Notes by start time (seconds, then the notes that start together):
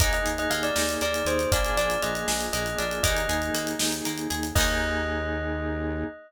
0.00 D#2 A#3 D#4 G#4 D#5, kick, closed hi-hat
0.13 D#5, closed hi-hat
0.26 D#2 G#4, closed hi-hat
0.38 D#5, closed hi-hat
0.50 D#2 A#3 F5, closed hi-hat
0.63 D5, closed hi-hat
0.76 D#2 D#4, snare
0.89 closed hi-hat
1.01 D#2 A#3 D5, closed hi-hat
1.14 closed hi-hat
1.25 D#2 G#4 C5, closed hi-hat
1.39 closed hi-hat
1.52 A#1 A#3 D4 F4 G#4 D5, kick, closed hi-hat
1.64 closed hi-hat
1.76 A#1 D4 D5, closed hi-hat
1.90 closed hi-hat
2.02 A#1 F4 D#5, closed hi-hat
2.15 closed hi-hat
2.28 A#1 G#4, snare
2.41 closed hi-hat
2.53 A#1 A#3 D#5, closed hi-hat
2.66 closed hi-hat
2.78 A#1 D4 D5, closed hi-hat
2.91 closed hi-hat
3.03 D#2 A#3 D#4 G#4 D#5, kick, closed hi-hat
3.16 closed hi-hat
3.29 D#2 G#4, closed hi-hat
3.42 closed hi-hat
3.54 D#2 A#3, closed hi-hat
3.67 closed hi-hat
3.79 D#2 D#4, snare
3.92 closed hi-hat
4.05 D#2 A#3, closed hi-hat
4.18 closed hi-hat
4.30 D#2 G#4, closed hi-hat
4.43 closed hi-hat
4.55 D#2 A#3 D#4 G#4 D#5, kick, crash
4.61 G#4